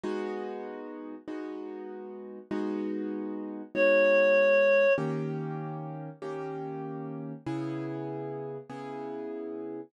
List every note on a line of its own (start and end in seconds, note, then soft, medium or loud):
0.03 1.15 G#3 loud
0.03 1.15 B3 loud
0.03 1.15 D#4 loud
0.03 1.15 F#4 loud
1.28 2.39 G#3 medium
1.28 2.39 B3 loud
1.28 2.39 D#4 medium
1.28 2.39 F#4 medium
2.51 3.62 G#3 loud
2.51 3.62 B3 loud
2.51 3.62 D#4 loud
2.51 3.62 F#4 loud
3.75 4.86 G#3 medium
3.75 4.86 B3 loud
3.75 4.86 D#4 loud
3.75 4.86 F#4 medium
3.75 4.93 C#5 medium
4.98 6.09 D#3 loud
4.98 6.09 A#3 loud
4.98 6.09 C#4 loud
4.98 6.09 G4 loud
6.22 7.33 D#3 loud
6.22 7.33 A#3 loud
6.22 7.33 C#4 medium
6.22 7.33 G4 loud
7.46 8.58 C#3 loud
7.46 8.58 B3 loud
7.46 8.58 E4 loud
7.46 8.58 G#4 loud
8.70 9.81 C#3 loud
8.70 9.81 B3 loud
8.70 9.81 E4 loud
8.70 9.81 G#4 loud